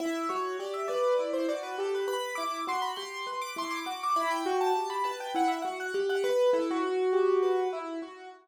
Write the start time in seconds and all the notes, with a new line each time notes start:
0.00 E4 E5
0.29 F#4 C#5
0.59 G4 D5
0.74 E5
0.88 B4 D5
1.19 E4
1.33 C5
1.49 F#4 D5
1.63 B4
1.78 G4 A4
1.94 B4
2.08 B4 B5
2.35 E4 D6
2.67 F#4 C6
2.82 B5
2.96 G4 C6
3.27 B4
3.41 D6
3.56 E4 C6
3.71 D6
3.85 F#4 D6
4.03 D6
4.16 E4 B5
4.31 G5
4.46 F#4
4.61 A5
4.75 G4
4.90 B5
5.04 B4 A5
5.20 G5
5.35 E4 F#5
5.48 E5
5.62 F#4 F#5
5.80 F#5
5.94 G4
6.09 F#5
6.24 B4
6.53 E4 A4
6.71 F#4
6.83 F#4
7.13 G4
7.43 B4
7.73 E4
8.02 F#4